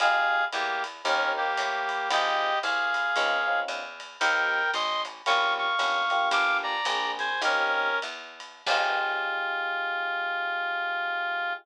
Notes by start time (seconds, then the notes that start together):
0.00 F2 D#4 F4 G4 G#4 F5, ride
0.53 E2 A#3 G4, hi-hat pedal, ride
0.84 ride
1.05 D#2 C4 C#4 D#4 G4 A#4, ride
1.37 A#3 G4
1.57 A2, kick, hi-hat pedal, ride
1.89 ride
2.10 G#1 C4 D#4 F4 G4 G#4 D#5, ride
2.63 C2 G#4 F5, hi-hat pedal, ride
2.94 ride
3.16 C#2 C4 C#4 D#4 F4, ride
3.47 C4 C#4 D#4 F4
3.68 E2, hi-hat pedal, ride
4.00 ride
4.20 D#2 A#3 C4 D#4 G4 A#4 G5, ride
4.73 A1 D#5 C6, kick, ride
5.05 hi-hat pedal, ride
5.26 A#1 A#3 C#4 F4 G4 F5 C#6, ride
5.58 F5 C#6
5.79 G1 A#3 C#4 F4 G4, hi-hat pedal, ride
6.10 A#3 D4 F4 G4, ride
6.31 G1 F5 D6, kick, ride
6.63 D5 A#5
6.85 A#1 A#3 C4 D4 G#4, hi-hat pedal, ride
7.19 C5 G#5, ride
7.42 D#2 A#3 C4 C#4 D#4 G4 A#4, ride
8.02 E2, hi-hat pedal, ride
8.40 ride
8.66 F2 D#4 F4 G4 G#4, kick, crash